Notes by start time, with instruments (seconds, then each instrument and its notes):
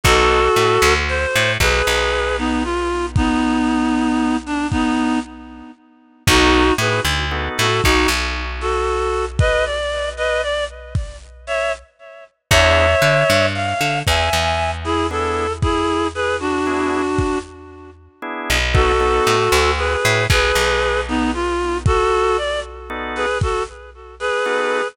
0.03 electric bass (finger) B1, drawbar organ B3 D#4 F#4 A4, clarinet F#4 A4, kick
0.56 electric bass (finger) A2
0.82 electric bass (finger) D2
1.09 clarinet C5
1.35 electric bass (finger) A2
1.60 electric bass (finger) B1, clarinet G#4 B4, kick
1.87 electric bass (finger) B1
2.38 clarinet B3 D#4
2.64 clarinet F4
3.16 clarinet B3 D#4, kick
4.46 clarinet D4
4.71 clarinet B3 D#4, kick
6.27 electric bass (finger) B1, drawbar organ B3 D#4 F#4 A4, clarinet D#4 F#4, kick
6.78 electric bass (finger) A2, clarinet G#4 B4
7.05 electric bass (finger) D2
7.31 drawbar organ B3 D#4 F#4 A4
7.58 electric bass (finger) A2, clarinet F#4 A4
7.83 electric bass (finger) B1, clarinet D#4 F#4, kick
8.08 electric bass (finger) B1
8.61 clarinet F#4 A4
9.39 clarinet B4 D#5, kick
9.65 clarinet D5
10.17 clarinet B4 D#5
10.42 clarinet D5
10.95 kick
11.47 clarinet C#5 E5
12.50 electric bass (finger) E2, drawbar organ B3 D4 E4 G#4, clarinet C#5 E5, kick
13.02 electric bass (finger) D3
13.30 electric bass (finger) G2
13.55 clarinet F5
13.81 electric bass (finger) D3
14.07 electric bass (finger) E2, clarinet E5 G#5, kick
14.33 electric bass (finger) E2
14.84 clarinet E4 G#4
15.11 drawbar organ B3 D4 E4 G#4, clarinet A4
15.62 clarinet E4 G#4, kick
16.15 clarinet G#4 B4
16.40 clarinet D4 F#4
16.66 drawbar organ B3 D4 E4 G#4
17.19 kick
18.22 drawbar organ B3 D4 E4 G#4
18.50 electric bass (finger) B1
18.74 drawbar organ B3 D#4 F#4 A4, clarinet F#4 A4, kick
19.00 drawbar organ B3 D#4 F#4 A4
19.27 electric bass (finger) A2
19.52 electric bass (finger) D2
19.77 clarinet G#4 B4
20.05 electric bass (finger) A2
20.30 electric bass (finger) B1, clarinet G#4 B4, kick
20.55 electric bass (finger) B1
21.08 clarinet B3 D#4
21.34 clarinet F4
21.86 clarinet F#4 A4, kick
22.37 clarinet D5
22.90 drawbar organ B3 D#4 F#4 A4
23.15 clarinet G#4 B4
23.41 clarinet F#4 A4, kick
24.20 clarinet G#4 B4
24.46 drawbar organ B3 D#4 F#4 A4